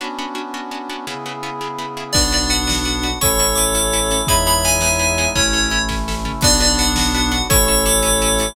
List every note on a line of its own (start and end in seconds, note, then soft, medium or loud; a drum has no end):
0.00 1.06 B3 medium
0.00 0.08 B3 medium
0.00 1.06 C#4 medium
0.00 0.08 C#4 medium
0.00 1.06 D4 medium
0.00 0.08 D4 medium
0.00 1.06 F#4 medium
0.00 0.08 F#4 medium
0.19 0.26 B3 medium
0.19 0.26 C#4 medium
0.19 0.26 D4 medium
0.19 0.26 F#4 medium
0.35 0.42 B3 medium
0.35 0.42 C#4 medium
0.35 0.42 D4 medium
0.35 0.42 F#4 medium
0.54 0.61 B3 medium
0.54 0.61 C#4 medium
0.54 0.61 D4 medium
0.54 0.61 F#4 medium
0.71 0.78 B3 medium
0.71 0.78 C#4 medium
0.71 0.78 D4 medium
0.71 0.78 F#4 medium
0.90 0.97 B3 medium
0.90 0.97 C#4 medium
0.90 0.97 D4 medium
0.90 0.97 F#4 medium
1.07 1.14 C#3 medium
1.07 2.15 C#3 medium
1.07 1.14 B3 medium
1.07 2.12 B3 medium
1.07 1.14 E4 medium
1.07 2.15 E4 medium
1.07 1.14 G#4 medium
1.07 2.15 G#4 medium
1.26 1.33 C#3 medium
1.26 1.33 B3 medium
1.26 1.33 E4 medium
1.26 1.33 G#4 medium
1.43 1.50 C#3 medium
1.43 1.50 B3 medium
1.43 1.50 E4 medium
1.43 1.50 G#4 medium
1.61 1.68 C#3 medium
1.61 1.68 B3 medium
1.61 1.68 E4 medium
1.61 1.68 G#4 medium
1.78 1.86 C#3 medium
1.78 1.86 B3 medium
1.78 1.86 E4 medium
1.78 1.86 G#4 medium
1.97 2.04 C#3 medium
1.97 2.04 B3 medium
1.97 2.04 E4 medium
1.97 2.04 G#4 medium
2.13 3.14 B1 medium
2.13 3.19 B3 medium
2.13 3.07 B3 loud
2.13 3.19 D4 medium
2.13 3.07 D4 loud
2.13 2.21 D4 medium
2.13 3.19 F#4 medium
2.13 2.21 F#4 medium
2.13 2.21 B4 medium
2.13 2.28 D5 medium
2.13 kick loud
2.13 crash loud
2.32 2.40 D4 medium
2.32 2.40 F#4 medium
2.32 2.40 B4 medium
2.32 2.51 D5 medium
2.32 closed hi-hat medium
2.50 2.57 D4 medium
2.50 2.57 F#4 medium
2.50 2.57 B4 medium
2.50 3.14 F#5 medium
2.50 closed hi-hat medium
2.67 2.74 D4 medium
2.67 2.74 F#4 medium
2.67 2.74 B4 medium
2.67 snare loud
2.85 2.92 D4 medium
2.85 2.92 F#4 medium
2.85 2.92 B4 medium
2.85 closed hi-hat medium
3.03 3.10 D4 medium
3.03 3.10 F#4 medium
3.03 3.10 B4 medium
3.03 closed hi-hat medium
3.21 4.20 A1 medium
3.21 4.29 A3 medium
3.21 3.28 C#4 medium
3.21 4.29 C#4 medium
3.21 3.28 E4 medium
3.21 4.29 E4 medium
3.21 3.28 A4 medium
3.21 4.21 A4 loud
3.21 4.21 C#5 loud
3.21 3.37 C#6 medium
3.21 kick loud
3.21 closed hi-hat loud
3.39 3.47 C#4 medium
3.39 3.47 E4 medium
3.39 3.47 A4 medium
3.39 3.56 C#6 medium
3.39 closed hi-hat medium
3.55 3.65 C#4 medium
3.55 3.65 E4 medium
3.55 3.65 A4 medium
3.55 4.24 D6 medium
3.55 closed hi-hat medium
3.75 3.82 C#4 medium
3.75 3.82 E4 medium
3.75 3.82 A4 medium
3.75 closed hi-hat loud
3.93 4.00 C#4 medium
3.93 4.00 E4 medium
3.93 4.00 A4 medium
3.93 closed hi-hat medium
4.11 4.18 C#4 medium
4.11 4.18 E4 medium
4.11 4.18 A4 medium
4.11 closed hi-hat loud
4.27 5.27 E2 medium
4.27 5.36 G#3 medium
4.27 4.35 B3 medium
4.27 5.36 B3 medium
4.27 4.35 D#4 medium
4.27 5.36 D#4 medium
4.27 4.35 E4 medium
4.27 5.36 E4 medium
4.27 4.35 G#4 medium
4.27 5.29 C#5 medium
4.27 5.29 E5 loud
4.27 4.43 B5 medium
4.27 kick loud
4.27 closed hi-hat loud
4.46 4.54 B3 medium
4.46 4.54 D#4 medium
4.46 4.54 E4 medium
4.46 4.54 G#4 medium
4.46 4.64 B5 medium
4.46 closed hi-hat medium
4.65 4.72 B3 medium
4.65 4.72 D#4 medium
4.65 4.72 E4 medium
4.65 4.72 G#4 medium
4.65 5.28 G#5 medium
4.65 closed hi-hat medium
4.80 4.89 B3 medium
4.80 4.89 D#4 medium
4.80 4.89 E4 medium
4.80 4.89 G#4 medium
4.80 snare loud
4.99 5.06 B3 medium
4.99 5.06 D#4 medium
4.99 5.06 E4 medium
4.99 5.06 G#4 medium
4.99 closed hi-hat medium
5.18 5.25 B3 medium
5.18 5.25 D#4 medium
5.18 5.25 E4 medium
5.18 5.25 G#4 medium
5.18 closed hi-hat medium
5.35 6.33 A1 medium
5.35 6.44 A3 medium
5.35 5.69 C#4 medium
5.35 5.43 C#4 medium
5.35 6.44 C#4 medium
5.35 5.69 E4 loud
5.35 5.43 E4 medium
5.35 6.44 E4 medium
5.35 5.43 A4 medium
5.35 5.82 C#5 medium
5.35 kick loud
5.35 closed hi-hat loud
5.53 5.60 C#4 medium
5.53 5.60 E4 medium
5.53 5.60 A4 medium
5.53 closed hi-hat medium
5.70 5.78 C#4 medium
5.70 5.78 E4 medium
5.70 5.78 A4 medium
5.70 closed hi-hat medium
5.89 5.96 C#4 medium
5.89 5.96 E4 medium
5.89 5.96 A4 medium
5.89 kick medium
5.89 snare medium
6.08 6.15 C#4 medium
6.08 6.15 E4 medium
6.08 6.15 A4 medium
6.08 snare loud
6.25 6.32 C#4 medium
6.25 6.32 E4 medium
6.25 6.32 A4 medium
6.25 floor tom loud
6.41 7.41 B1 medium
6.41 7.48 B3 medium
6.41 7.36 B3 loud
6.41 7.48 D4 medium
6.41 6.49 D4 loud
6.41 7.36 D4 loud
6.41 7.48 F#4 medium
6.41 6.49 F#4 loud
6.41 6.49 B4 loud
6.41 6.59 D5 medium
6.41 kick loud
6.41 crash loud
6.60 6.68 D4 loud
6.60 6.68 F#4 loud
6.60 6.68 B4 loud
6.60 6.79 D5 medium
6.60 closed hi-hat medium
6.79 6.86 D4 loud
6.79 6.86 F#4 medium
6.79 6.86 B4 loud
6.79 7.42 F#5 medium
6.79 closed hi-hat medium
6.96 7.05 D4 loud
6.96 7.05 F#4 medium
6.96 7.05 B4 medium
6.96 snare loud
7.15 7.22 D4 medium
7.15 7.22 F#4 medium
7.15 7.22 B4 medium
7.15 closed hi-hat loud
7.32 7.39 D4 loud
7.32 7.39 F#4 medium
7.32 7.39 B4 medium
7.32 closed hi-hat loud
7.49 8.49 A1 loud
7.49 8.55 A3 medium
7.49 7.57 C#4 loud
7.49 8.55 C#4 medium
7.49 7.57 E4 loud
7.49 8.55 E4 medium
7.49 8.48 A4 loud
7.49 7.57 A4 loud
7.49 8.48 C#5 loud
7.49 7.66 C#6 medium
7.49 kick loud
7.49 closed hi-hat loud
7.67 7.75 C#4 medium
7.67 7.75 E4 medium
7.67 7.75 A4 loud
7.67 7.84 C#6 medium
7.67 closed hi-hat medium
7.86 7.93 C#4 medium
7.86 7.93 E4 medium
7.86 7.93 A4 loud
7.86 8.54 D6 medium
7.86 closed hi-hat loud
8.03 8.10 C#4 loud
8.03 8.10 E4 medium
8.03 8.10 A4 medium
8.03 closed hi-hat loud
8.22 8.29 C#4 loud
8.22 8.29 E4 loud
8.22 8.29 A4 medium
8.22 closed hi-hat loud
8.39 8.47 C#4 medium
8.39 8.47 E4 medium
8.39 8.47 A4 medium
8.39 closed hi-hat loud